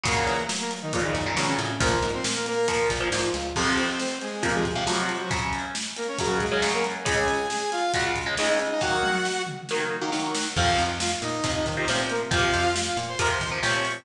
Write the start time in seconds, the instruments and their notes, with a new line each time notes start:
0.04 electric bass (finger) F#2, overdriven guitar A#2 C#3 F#3, lead 2 (sawtooth) A#3 A#4, kick, closed hi-hat
0.27 electric bass (finger) E3, closed hi-hat
0.49 electric bass (finger) F#3, snare
0.60 lead 2 (sawtooth) A#3 A#4
0.71 closed hi-hat
0.82 lead 2 (sawtooth) D#3 D#4
0.93 overdriven guitar A#2 C#3 F#3, lead 2 (sawtooth) F3 F4, kick, closed hi-hat
1.04 lead 2 (sawtooth) D#3 D#4
1.15 electric bass (finger) F#2, kick, closed hi-hat
1.26 overdriven guitar A#2 C#3 F#3
1.36 overdriven guitar A#2 C#3 F#3, lead 2 (sawtooth) C#3 C#4, electric bass (finger) E3, snare
1.48 lead 2 (sawtooth) C#3 C#4
1.58 electric bass (finger) A2, closed hi-hat
1.80 electric bass (finger) A#1, overdriven guitar A#2 F3, lead 2 (sawtooth) A#3 A#4, kick, closed hi-hat
2.02 electric bass (finger) G#2, closed hi-hat
2.13 lead 2 (sawtooth) C4 C5
2.24 electric bass (finger) A#2, snare
2.35 lead 2 (sawtooth) A#3 A#4
2.46 lead 2 (sawtooth) A#3 A#4, closed hi-hat
2.68 overdriven guitar A#2 F3, lead 2 (sawtooth) A#3 A#4, kick, closed hi-hat
2.90 electric bass (finger) A#1, kick, closed hi-hat
3.00 overdriven guitar A#2 F3
3.12 electric bass (finger) G#2, overdriven guitar A#2 F3, snare
3.34 electric bass (finger) C#2, closed hi-hat
3.56 overdriven guitar F2 C3 F3, lead 2 (sawtooth) C4 C5, kick, crash
3.78 lead 2 (sawtooth) C4 C5, closed hi-hat
4.00 lead 2 (sawtooth) C4 C5, snare
4.21 lead 2 (sawtooth) G#3 G#4, closed hi-hat
4.43 overdriven guitar F2 C3 F3, lead 2 (sawtooth) A#3 A#4, kick, closed hi-hat
4.54 lead 2 (sawtooth) G#3 G#4
4.65 kick, closed hi-hat
4.75 overdriven guitar F2 C3 F3
4.87 overdriven guitar F2 C3 F3, lead 2 (sawtooth) F#3 F#4, snare
4.98 lead 2 (sawtooth) F#3 F#4
5.09 closed hi-hat
5.20 lead 2 (sawtooth) F#3 F#4
5.31 overdriven guitar F#2 C#3 F#3, kick, closed hi-hat
5.53 closed hi-hat
5.75 snare
5.97 lead 2 (sawtooth) A#3 A#4, closed hi-hat
6.08 lead 2 (sawtooth) C#4 C#5
6.19 overdriven guitar F#2 C#3 F#3, lead 2 (sawtooth) F#3 F#4, kick, closed hi-hat
6.40 lead 2 (sawtooth) G#3 G#4, kick, closed hi-hat
6.52 overdriven guitar F#2 C#3 F#3
6.62 overdriven guitar F#2 C#3 F#3, snare
6.73 lead 2 (sawtooth) A#3 A#4
6.84 closed hi-hat
7.05 overdriven guitar C#2 C#3 G#3, lead 2 (sawtooth) G#4 G#5, kick, closed hi-hat
7.28 lead 2 (sawtooth) G#4 G#5, closed hi-hat
7.50 lead 2 (sawtooth) G#4 G#5, snare
7.72 lead 2 (sawtooth) F4 F5, closed hi-hat
7.94 overdriven guitar C#2 C#3 G#3, lead 2 (sawtooth) F#4 F#5, kick, closed hi-hat
8.05 lead 2 (sawtooth) F4 F5
8.16 kick, closed hi-hat
8.26 overdriven guitar C#2 C#3 G#3
8.37 overdriven guitar C#2 C#3 G#3, lead 2 (sawtooth) D#4 D#5, snare
8.49 lead 2 (sawtooth) D#4 D#5
8.59 closed hi-hat
8.70 lead 2 (sawtooth) D#4 D#5
8.81 overdriven guitar D#3 F#3 A#3, lead 2 (sawtooth) F#4 F#5, kick, snare
9.03 high tom
9.25 snare
9.47 mid tom
9.69 overdriven guitar D#3 F#3 A#3, snare
10.02 overdriven guitar D#3 F#3 A#3
10.12 overdriven guitar D#3 F#3 A#3, snare
10.35 snare
10.56 electric bass (finger) F2, overdriven guitar C3 F3, lead 2 (sawtooth) F4 F5, kick, crash
10.78 electric bass (finger) F2, closed hi-hat
11.00 lead 2 (sawtooth) F4 F5, snare
11.22 electric bass (finger) A#2, lead 2 (sawtooth) D#4 D#5, closed hi-hat
11.44 electric bass (finger) F2, overdriven guitar C3 F3, kick, closed hi-hat
11.55 lead 2 (sawtooth) D#4 D#5
11.66 electric bass (finger) D#3, kick, closed hi-hat
11.77 overdriven guitar C3 F3, lead 2 (sawtooth) D#4 D#5
11.88 electric bass (finger) A#2, overdriven guitar C3 F3, lead 2 (sawtooth) C4 C5, snare
12.09 lead 2 (sawtooth) A#3 A#4, closed hi-hat
12.31 electric bass (finger) F2, overdriven guitar C3 F3, lead 2 (sawtooth) F4 F5, kick, closed hi-hat
12.53 electric bass (finger) F2, closed hi-hat
12.76 snare
12.86 lead 2 (sawtooth) F4 F5
12.97 electric bass (finger) A#2, closed hi-hat
13.08 lead 2 (sawtooth) C5 C6
13.19 electric bass (finger) F2, overdriven guitar C3 F3, lead 2 (sawtooth) A#4 A#5, kick, closed hi-hat
13.30 lead 2 (sawtooth) C5 C6
13.41 electric bass (finger) D#3, kick, closed hi-hat
13.51 overdriven guitar C3 F3
13.63 electric bass (finger) A#2, overdriven guitar C3 F3, lead 2 (sawtooth) C#5 C#6, snare
13.74 lead 2 (sawtooth) C#5 C#6
13.85 closed hi-hat